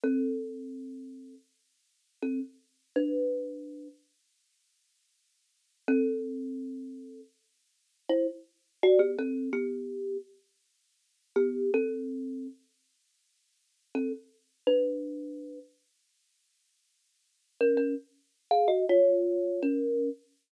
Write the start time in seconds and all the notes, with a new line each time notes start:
0.04 C4 A4
2.22 C4 A4
2.96 D4 B4
5.88 C4 A4
8.09 E4 C5
8.83 F#4 D5
8.99 B3 G4
9.19 C4 A4
9.53 B3 G4
11.36 B3 G4
11.74 C4 A4
13.95 C4 A4
14.67 D4 B4
17.61 C#4 A#4
17.77 C#4 A#4
18.51 G#4 F5
18.68 F#4 D#5
18.89 F4 C#5
19.62 C#4 A#4